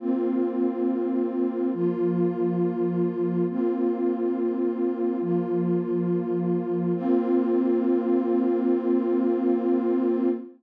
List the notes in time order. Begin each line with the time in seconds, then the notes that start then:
0.00 A#3 C4 F4
1.74 F3 A#3 F4
3.49 A#3 C4 F4
5.21 F3 A#3 F4
6.95 A#3 C4 F4